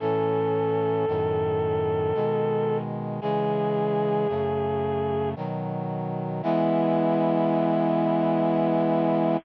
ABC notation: X:1
M:3/4
L:1/8
Q:1/4=56
K:E
V:1 name="Brass Section"
A6 | G4 z2 | E6 |]
V:2 name="Brass Section"
[A,,E,C]2 [F,,A,,D,]2 [B,,D,G,]2 | [C,E,G,]2 [F,,C,A,]2 [B,,D,F,]2 | [E,G,B,]6 |]